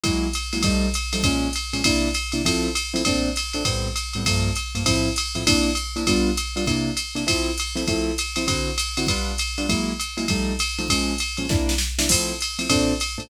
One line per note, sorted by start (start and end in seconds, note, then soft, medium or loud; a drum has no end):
0.04 0.27 F#3 loud
0.04 0.27 G#3 medium
0.04 0.27 A#3 loud
0.04 0.27 E4 medium
0.04 kick medium
0.04 ride loud
0.33 hi-hat pedal medium
0.33 ride loud
0.53 0.61 F#3 medium
0.53 0.61 G#3 medium
0.53 0.61 A#3 medium
0.53 0.61 E4 medium
0.53 ride medium
0.63 0.87 F3 medium
0.63 0.87 G3 loud
0.63 0.87 A3 loud
0.63 0.87 D#4 medium
0.63 kick medium
0.63 ride loud
0.94 hi-hat pedal loud
0.94 ride loud
1.13 1.21 F3 medium
1.13 1.21 G3 medium
1.13 1.21 A3 medium
1.13 1.21 D#4 medium
1.13 ride loud
1.23 1.48 A#2 loud
1.23 1.48 F3 medium
1.23 1.48 G#3 loud
1.23 1.48 C#4 medium
1.23 kick medium
1.23 ride loud
1.53 hi-hat pedal medium
1.53 ride loud
1.73 1.81 A#2 medium
1.73 1.81 F3 medium
1.73 1.81 G#3 medium
1.73 1.81 C#4 medium
1.73 ride medium
1.84 2.08 C3 medium
1.84 2.08 A#3 medium
1.84 2.08 D4 medium
1.84 2.08 E4 medium
1.84 kick medium
1.84 ride loud
2.14 hi-hat pedal medium
2.14 ride loud
2.32 2.41 C3 medium
2.32 2.41 A#3 medium
2.32 2.41 D4 medium
2.32 2.41 E4 medium
2.32 ride medium
2.45 2.68 F3 loud
2.45 2.68 A3 loud
2.45 2.68 C4 medium
2.45 2.68 E4 medium
2.45 kick medium
2.45 ride loud
2.75 hi-hat pedal medium
2.75 ride loud
2.94 3.02 F3 medium
2.94 3.02 A3 medium
2.94 3.02 C4 medium
2.94 3.02 E4 medium
2.94 ride loud
3.05 3.29 A#2 loud
3.05 3.29 A3 loud
3.05 3.29 C4 medium
3.05 3.29 D4 medium
3.05 kick medium
3.05 ride loud
3.36 hi-hat pedal medium
3.36 ride loud
3.53 3.63 A#2 medium
3.53 3.63 A3 medium
3.53 3.63 C4 medium
3.53 3.63 D4 medium
3.53 ride medium
3.65 3.88 A2 medium
3.65 3.88 G3 medium
3.65 3.88 B3 medium
3.65 3.88 C4 medium
3.65 kick medium
3.65 ride loud
3.96 hi-hat pedal medium
3.96 ride loud
4.13 4.23 A2 medium
4.13 4.23 G3 medium
4.13 4.23 B3 medium
4.13 4.23 C4 medium
4.13 ride medium
4.25 4.50 G2 loud
4.25 4.50 F3 medium
4.25 4.50 A3 medium
4.25 4.50 A#3 medium
4.25 kick medium
4.25 ride loud
4.55 hi-hat pedal medium
4.55 ride medium
4.75 4.83 G2 medium
4.75 4.83 F3 medium
4.75 4.83 A3 medium
4.75 4.83 A#3 medium
4.75 ride medium
4.86 5.09 A2 medium
4.86 5.09 F3 medium
4.86 5.09 C4 medium
4.86 5.09 E4 medium
4.86 kick medium
4.86 ride loud
5.16 hi-hat pedal loud
5.16 ride loud
5.35 5.43 A2 medium
5.35 5.43 F3 medium
5.35 5.43 C4 medium
5.35 5.43 E4 medium
5.35 ride medium
5.47 5.70 C3 medium
5.47 5.70 A#3 medium
5.47 5.70 D4 medium
5.47 5.70 E4 medium
5.47 kick medium
5.47 ride loud
5.75 hi-hat pedal medium
5.75 ride loud
5.96 6.04 C3 medium
5.96 6.04 A#3 medium
5.96 6.04 D4 medium
5.96 6.04 E4 medium
5.96 ride medium
6.07 6.30 G3 medium
6.07 6.30 B3 medium
6.07 6.30 D4 medium
6.07 6.30 F4 medium
6.07 kick medium
6.07 ride loud
6.37 hi-hat pedal loud
6.37 ride loud
6.56 6.64 G3 medium
6.56 6.64 B3 medium
6.56 6.64 D4 medium
6.56 6.64 F4 medium
6.56 ride medium
6.66 6.90 C3 medium
6.66 6.90 A#3 medium
6.66 6.90 D4 medium
6.66 6.90 E4 medium
6.66 kick medium
6.66 ride loud
6.97 hi-hat pedal loud
6.97 ride loud
7.15 7.23 C3 medium
7.15 7.23 A#3 medium
7.15 7.23 D4 medium
7.15 7.23 E4 medium
7.15 ride medium
7.27 7.50 F3 loud
7.27 7.50 A3 medium
7.27 7.50 C4 medium
7.27 7.50 E4 medium
7.27 kick medium
7.27 ride loud
7.58 hi-hat pedal loud
7.58 ride loud
7.76 7.84 F3 medium
7.76 7.84 A3 medium
7.76 7.84 C4 medium
7.76 7.84 E4 medium
7.76 ride medium
7.87 8.11 F3 medium
7.87 8.11 A3 medium
7.87 8.11 C4 medium
7.87 8.11 E4 medium
7.87 kick medium
7.87 ride loud
8.18 hi-hat pedal loud
8.18 ride loud
8.36 8.45 F3 medium
8.36 8.45 A3 medium
8.36 8.45 C4 medium
8.36 8.45 E4 medium
8.36 ride loud
8.47 8.70 D3 medium
8.47 8.70 C4 medium
8.47 8.70 E4 medium
8.47 8.70 F#4 medium
8.47 kick medium
8.47 ride loud
8.78 hi-hat pedal loud
8.78 ride loud
8.97 9.05 D3 medium
8.97 9.05 C4 medium
8.97 9.05 E4 medium
8.97 9.05 F#4 medium
8.97 ride loud
9.07 9.32 G3 medium
9.07 9.32 B3 loud
9.07 9.32 D4 medium
9.07 9.32 F4 medium
9.07 kick medium
9.07 ride loud
9.38 hi-hat pedal loud
9.38 ride loud
9.58 9.66 G3 medium
9.58 9.66 B3 medium
9.58 9.66 D4 medium
9.58 9.66 F4 medium
9.58 ride medium
9.69 9.92 F#3 medium
9.69 9.92 G#3 medium
9.69 9.92 A#3 medium
9.69 9.92 E4 medium
9.69 kick medium
9.69 ride loud
10.00 hi-hat pedal loud
10.00 ride medium
10.17 10.25 F#3 medium
10.17 10.25 G#3 medium
10.17 10.25 A#3 medium
10.17 10.25 E4 medium
10.17 ride medium
10.28 10.53 F3 medium
10.28 10.53 G3 medium
10.28 10.53 A3 loud
10.28 10.53 D#4 medium
10.28 kick medium
10.28 ride loud
10.59 hi-hat pedal medium
10.59 ride loud
10.78 10.87 F3 medium
10.78 10.87 G3 medium
10.78 10.87 A3 medium
10.78 10.87 D#4 medium
10.78 ride medium
10.88 11.13 A#2 medium
10.88 11.13 F3 medium
10.88 11.13 G#3 medium
10.88 11.13 C#4 medium
10.88 kick medium
10.88 ride loud
11.18 hi-hat pedal medium
11.18 ride loud
11.37 11.46 A#2 medium
11.37 11.46 F3 medium
11.37 11.46 G#3 medium
11.37 11.46 C#4 medium
11.37 ride medium
11.49 11.73 C3 medium
11.49 11.73 A#3 loud
11.49 11.73 D4 loud
11.49 11.73 E4 medium
11.49 kick loud
11.49 snare medium
11.69 snare loud
11.78 snare loud
11.98 12.07 C3 medium
11.98 12.07 A#3 medium
11.98 12.07 D4 medium
11.98 12.07 E4 medium
11.98 snare loud
12.09 12.33 F3 medium
12.09 12.33 A3 medium
12.09 12.33 C4 medium
12.09 12.33 E4 medium
12.09 kick medium
12.09 crash loud
12.09 ride loud
12.41 hi-hat pedal medium
12.41 ride loud
12.59 12.67 F3 medium
12.59 12.67 A3 medium
12.59 12.67 C4 medium
12.59 12.67 E4 medium
12.59 ride loud
12.69 12.93 A#2 loud
12.69 12.93 A3 medium
12.69 12.93 C4 loud
12.69 12.93 D4 loud
12.69 kick medium
12.69 ride loud
13.00 hi-hat pedal medium
13.00 ride loud
13.18 13.26 A#2 medium
13.18 13.26 A3 medium
13.18 13.26 C4 medium
13.18 13.26 D4 medium
13.18 ride medium